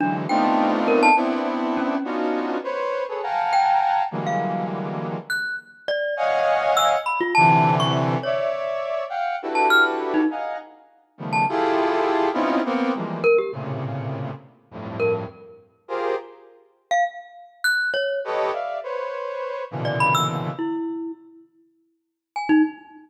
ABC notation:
X:1
M:7/8
L:1/16
Q:1/4=102
K:none
V:1 name="Brass Section"
[D,E,^F,^G,]2 [A,B,CD^D=F]6 [B,C=DE]6 | [B,^CD^DF^F]4 [B=c^c]3 [^GABc] [=f^f=g^ga^a]6 | [D,E,^F,G,^G,^A,]8 z6 | [^c^df^f^g]6 z2 [=C,=D,E,]6 |
[^cde]6 [f^fg]2 [DE^FGAB]6 | [^df^f^g^a]2 z4 [^C,^D,=F,=G,=A,B,]2 [EFG^GA]6 | [B,C^C^DEF]2 [^A,B,=C]2 [E,F,G,^G,A,]2 z2 [=A,,^A,,C,^C,]6 | z2 [F,,G,,A,,]4 z4 [FG^G^Ac]2 z2 |
z12 [GAB^c^d]2 | [def]2 [Bc^c]6 [^A,,B,,^C,D,E,]6 | z14 |]
V:2 name="Glockenspiel"
D z g3 z ^A =a z4 ^C2 | z10 g4 | z f3 z4 ^f'2 z2 d2 | z4 e' z b F a3 ^c' z2 |
^c2 z7 a f' z2 ^D | z7 a z6 | z6 ^A G z6 | z4 ^A z9 |
z3 f z4 ^f'2 ^c2 z2 | z9 d b e' z2 | E4 z8 ^g ^D |]